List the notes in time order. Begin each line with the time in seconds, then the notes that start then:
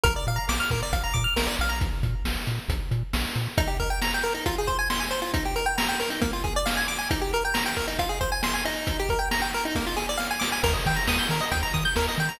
0.03 A#1 A#4, kick, closed hi-hat
0.16 D5
0.27 A#2 F5, closed hi-hat
0.36 A#5
0.49 A#1 D6, snare
0.60 F6
0.70 A#2 A#4, kick, closed hi-hat
0.83 D5
0.93 A#1 F5, kick, closed hi-hat
1.03 A#5
1.14 A#2 D6, kick, closed hi-hat
1.24 F6
1.36 A#1 A#4, snare
1.47 D5
1.59 A#1 F5, closed hi-hat
1.69 A#5
1.81 kick, closed hi-hat
2.03 A#2, kick, closed hi-hat
2.25 A#1, snare
2.47 A#2, closed hi-hat
2.68 A#1, kick, closed hi-hat
2.91 A#2, closed hi-hat
3.13 A#1, snare
3.35 A#2, closed hi-hat
3.58 D#4, kick, closed hi-hat
3.67 G4
3.80 A#4, kick, closed hi-hat
3.90 G5
4.02 A#5, snare
4.14 G5
4.23 A#4, closed hi-hat
4.34 D#4
4.46 F4, kick, closed hi-hat
4.58 G#4
4.67 C5, kick, closed hi-hat
4.79 G#5
4.90 C6, snare
5.00 G#5
5.11 C5, closed hi-hat
5.22 F4
5.34 D#4, kick, closed hi-hat
5.45 G4
5.56 A#4, closed hi-hat
5.66 G5
5.78 A#5, snare
5.88 G5
6.00 A#4, closed hi-hat
6.10 D#4
6.21 A#3, kick, closed hi-hat
6.33 F4
6.44 G#4, kick, closed hi-hat
6.56 D5
6.66 F5, snare
6.77 G#5
6.88 D6, closed hi-hat
6.98 G#5
7.10 D#4, kick, closed hi-hat
7.21 G4
7.33 A#4, closed hi-hat
7.45 G5
7.54 A#5, snare
7.66 G5
7.77 A#4, kick, closed hi-hat
7.88 D#4
7.99 F4, kick, closed hi-hat
8.09 G#4
8.21 C5, kick, closed hi-hat
8.32 G#5
8.43 C6, snare
8.54 G#5
8.65 D#4, closed hi-hat
8.87 kick, closed hi-hat
8.99 G4
9.09 A#4, kick, closed hi-hat
9.19 G5
9.31 A#5, snare
9.42 G5
9.53 A#4, closed hi-hat
9.65 D#4
9.75 A#3, kick, snare
9.86 F4
9.97 G#4, snare
10.09 D5
10.17 F5, snare
10.31 G#5
10.40 D6, snare
10.52 G#5
10.63 D#2 A#4, kick, crash
10.73 D#5
10.85 D#3 G5, kick, closed hi-hat
10.96 A#5
11.08 D#2 D#6, snare
11.19 G6
11.29 D#3 A#4, closed hi-hat
11.41 D#5
11.51 D#2 G5, kick, closed hi-hat
11.63 A#5
11.74 D#3 D#6, kick, closed hi-hat
11.85 G6
11.96 D#2 A#4, snare
12.08 D#5
12.18 D#3 G5, closed hi-hat
12.29 A#5